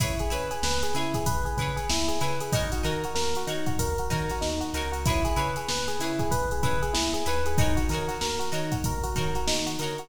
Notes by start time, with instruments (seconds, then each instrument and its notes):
0.00 synth bass 1 C#2, pizzicato strings E4 G#4 B4 C#5, electric piano 1 E4, kick, closed hi-hat
0.19 electric piano 1 G#4, closed hi-hat
0.30 synth bass 1 C#3, pizzicato strings E4 G#4 B4 C#5, electric piano 1 B4, closed hi-hat
0.51 electric piano 1 G#4, closed hi-hat
0.63 synth bass 1 C#2, electric piano 1 B4, snare
0.83 electric piano 1 G#4, closed hi-hat
0.94 synth bass 1 C#3, pizzicato strings E4 G#4 B4 C#5, electric piano 1 E4, snare, closed hi-hat
1.14 electric piano 1 G#4, kick, closed hi-hat
1.26 synth bass 1 C#2, electric piano 1 B4, kick, closed hi-hat
1.45 electric piano 1 G#4, closed hi-hat
1.57 synth bass 1 C#3, pizzicato strings E4 G#4 B4, electric piano 1 B4, kick, closed hi-hat
1.62 pizzicato strings C#5
1.76 electric piano 1 G#4, closed hi-hat
1.89 synth bass 1 C#2, electric piano 1 E4, snare
2.08 electric piano 1 G#4, closed hi-hat
2.21 synth bass 1 C#3, pizzicato strings E4 G#4 B4 C#5, electric piano 1 B4, closed hi-hat
2.40 electric piano 1 G#4, closed hi-hat
2.53 synth bass 1 D#2, electric piano 1 D#4, pizzicato strings D#4 F#4 A#4 C#5, kick, closed hi-hat
2.72 electric piano 1 F#4, closed hi-hat
2.83 synth bass 1 D#3, pizzicato strings D#4 F#4 A#4 C#5, electric piano 1 A#4, closed hi-hat
3.04 electric piano 1 F#4, closed hi-hat
3.15 synth bass 1 D#2, electric piano 1 A#4, snare
3.35 electric piano 1 F#4, closed hi-hat
3.47 synth bass 1 D#3, electric piano 1 D#4, pizzicato strings D#4 F#4 A#4 C#5, closed hi-hat
3.66 electric piano 1 F#4, kick, closed hi-hat
3.78 synth bass 1 D#2, electric piano 1 A#4, kick, closed hi-hat
3.98 electric piano 1 F#4, closed hi-hat
4.10 synth bass 1 D#3, pizzicato strings D#4 F#4 A#4 C#5, electric piano 1 A#4, kick, closed hi-hat
4.29 electric piano 1 F#4, snare, closed hi-hat
4.41 synth bass 1 D#2, electric piano 1 D#4, snare
4.61 electric piano 1 F#4, closed hi-hat
4.74 synth bass 1 C#2, pizzicato strings D#4 F#4 A#4 C#5, electric piano 1 A#4, snare, closed hi-hat
4.92 electric piano 1 F#4, closed hi-hat
5.06 electric piano 1 E4, pizzicato strings E4 G#4 B4, kick, closed hi-hat
5.10 pizzicato strings C#5
5.25 electric piano 1 G#4, closed hi-hat
5.36 synth bass 1 C#3, pizzicato strings E4 G#4 B4 C#5, electric piano 1 B4, closed hi-hat
5.56 electric piano 1 G#4, closed hi-hat
5.69 synth bass 1 C#2, electric piano 1 B4, snare
5.88 electric piano 1 G#4, snare, closed hi-hat
5.99 synth bass 1 C#3, electric piano 1 E4, pizzicato strings E4 G#4 B4, closed hi-hat
6.04 pizzicato strings C#5
6.19 electric piano 1 G#4, kick, closed hi-hat
6.31 synth bass 1 C#2, electric piano 1 B4, kick, closed hi-hat
6.51 electric piano 1 G#4, closed hi-hat
6.63 synth bass 1 C#3, pizzicato strings E4 G#4 B4 C#5, electric piano 1 B4, kick, closed hi-hat
6.82 electric piano 1 G#4, closed hi-hat
6.93 synth bass 1 C#2, electric piano 1 E4, snare
7.13 electric piano 1 G#4, closed hi-hat
7.26 synth bass 1 D#2, pizzicato strings E4 G#4 B4 C#5, electric piano 1 B4, closed hi-hat
7.46 electric piano 1 G#4, closed hi-hat
7.58 pizzicato strings D#4 F#4 A#4 C#5, electric piano 1 D#4, kick, closed hi-hat
7.77 electric piano 1 F#4, closed hi-hat
7.89 synth bass 1 D#3, pizzicato strings D#4 F#4, electric piano 1 A#4, closed hi-hat
7.93 pizzicato strings A#4 C#5
8.08 electric piano 1 F#4, snare, closed hi-hat
8.21 synth bass 1 D#2, electric piano 1 A#4, snare
8.39 electric piano 1 F#4, closed hi-hat
8.52 synth bass 1 D#3, pizzicato strings D#4 F#4 A#4 C#5, electric piano 1 D#4, closed hi-hat
8.72 electric piano 1 F#4, kick, closed hi-hat
8.84 synth bass 1 D#2, electric piano 1 A#4, kick, closed hi-hat
9.03 electric piano 1 F#4, closed hi-hat
9.16 synth bass 1 D#3, pizzicato strings D#4 F#4 A#4 C#5, electric piano 1 A#4, kick, closed hi-hat
9.35 electric piano 1 F#4, closed hi-hat
9.47 synth bass 1 D#3, electric piano 1 D#4, snare
9.66 electric piano 1 F#4, closed hi-hat
9.79 synth bass 1 D3, pizzicato strings D#4 F#4 A#4, electric piano 1 A#4, closed hi-hat
9.84 pizzicato strings C#5
9.98 electric piano 1 F#4, closed hi-hat